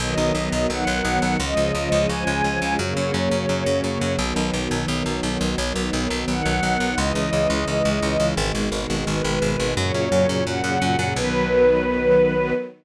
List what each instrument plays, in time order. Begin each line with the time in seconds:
0.00 electric bass (finger) B1, string ensemble 1 D#3 F#3 B3 D#5
0.18 electric bass (finger) B1
0.35 electric bass (finger) B1
0.52 electric bass (finger) B1
0.70 electric bass (finger) B1, string ensemble 1 F#5
0.87 electric bass (finger) B1
1.05 electric bass (finger) B1
1.22 electric bass (finger) B1
1.39 electric bass (finger) C#2, string ensemble 1 C#3 F3 G#3 D#5
1.57 electric bass (finger) C#2
1.75 electric bass (finger) C#2
1.92 electric bass (finger) C#2
2.09 electric bass (finger) C#2, string ensemble 1 G#5
2.27 electric bass (finger) C#2
2.44 electric bass (finger) C#2
2.62 electric bass (finger) C#2
2.79 electric bass (finger) F#2, string ensemble 1 C#3 F#3 A#3 C#5
2.97 electric bass (finger) F#2
3.14 electric bass (finger) F#2
3.31 electric bass (finger) F#2
3.49 electric bass (finger) F#2
3.66 electric bass (finger) F#2
3.84 electric bass (finger) F#2
4.01 electric bass (finger) F#2
4.18 electric bass (finger) B1, string ensemble 1 D#3 F#3 B3
4.36 electric bass (finger) B1
4.53 electric bass (finger) B1
4.71 electric bass (finger) B1
4.88 electric bass (finger) B1
5.06 electric bass (finger) B1
5.23 electric bass (finger) B1
5.41 electric bass (finger) B1
5.58 electric bass (finger) B1, string ensemble 1 D#3 F#3 B3
5.76 electric bass (finger) B1
5.93 electric bass (finger) B1
6.10 electric bass (finger) B1
6.28 electric bass (finger) B1, string ensemble 1 F#5
6.45 electric bass (finger) B1
6.63 electric bass (finger) B1
6.80 electric bass (finger) B1
6.98 electric bass (finger) C#2, string ensemble 1 C#3 E3 G#3 D#5
7.15 electric bass (finger) C#2
7.33 electric bass (finger) C#2
7.50 electric bass (finger) C#2
7.68 electric bass (finger) C#2
7.85 electric bass (finger) C#2
8.02 electric bass (finger) C#2
8.20 electric bass (finger) C#2
8.37 electric bass (finger) G#1, string ensemble 1 B2 D#3 G#3
8.55 electric bass (finger) G#1
8.72 electric bass (finger) G#1
8.90 electric bass (finger) G#1
9.07 electric bass (finger) G#1, string ensemble 1 B4
9.24 electric bass (finger) G#1
9.42 electric bass (finger) G#1
9.60 electric bass (finger) G#1
9.77 electric bass (finger) F#2, string ensemble 1 A#2 C#3 F#3 C#5
9.94 electric bass (finger) F#2
10.12 electric bass (finger) F#2
10.29 electric bass (finger) F#2
10.47 electric bass (finger) F#2, string ensemble 1 F#5
10.64 electric bass (finger) F#2
10.82 electric bass (finger) F#2
10.99 electric bass (finger) F#2
11.16 electric bass (finger) B1, string ensemble 1 D#3 F#3 B3 B4